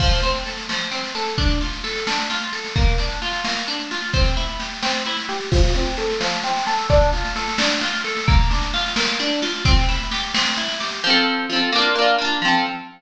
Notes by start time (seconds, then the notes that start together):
0.00 F3, kick, snare, crash
0.12 snare
0.22 C4, snare
0.34 snare
0.45 A4, snare
0.57 snare
0.69 F3, snare
0.80 snare
0.91 C4, snare
1.04 snare
1.15 A4, snare
1.27 snare
1.38 D4, kick, snare
1.50 snare
1.61 F4, snare
1.73 snare
1.84 A4, snare
1.95 snare
2.07 D4, snare
2.19 snare
2.30 F4, snare
2.42 snare
2.53 A4, snare
2.65 snare
2.76 A#3, kick, snare
2.87 snare
2.98 D4, snare
3.10 snare
3.22 F4, snare
3.33 snare
3.44 A#3, snare
3.57 snare
3.68 D4, snare
3.79 snare
3.91 F4, snare
4.03 snare
4.13 C4, kick, snare
4.24 snare
4.37 E4, snare
4.49 snare
4.60 G4, snare
4.71 snare
4.83 C4, snare
4.94 snare
5.06 E4, snare
5.17 snare
5.29 G4, snare
5.41 snare
5.52 F3, kick, snare, crash
5.63 snare
5.75 C4, snare
5.86 snare
5.97 A4, snare
6.09 snare
6.21 F3, snare
6.32 snare
6.43 C4, snare
6.56 snare
6.67 A4, snare
6.78 snare
6.90 D4, kick, snare
7.01 snare
7.13 F4, snare
7.25 snare
7.36 A4, snare
7.48 snare
7.58 D4, snare
7.70 snare
7.81 F4, snare
7.93 snare
8.04 A4, snare
8.17 snare
8.28 A#3, kick, snare
8.39 snare
8.50 D4, snare
8.61 snare
8.73 F4, snare
8.86 snare
8.96 A#3, snare
9.08 snare
9.20 D4, snare
9.31 snare
9.42 F4, snare
9.53 snare
9.65 C4, kick, snare
9.77 snare
9.89 E4, snare
10.00 snare
10.11 G4, snare
10.23 snare
10.34 C4, snare
10.46 snare
10.57 E4, snare
10.68 snare
10.80 G4, snare
10.91 snare
11.04 F3 C4
11.10 A4
11.50 F3 C4
11.56 A4
11.72 A#3 D4
11.79 F4
11.95 A#3 D4
12.02 F4
12.18 A#3 D4
12.25 F4
12.42 F3 C4
12.48 A4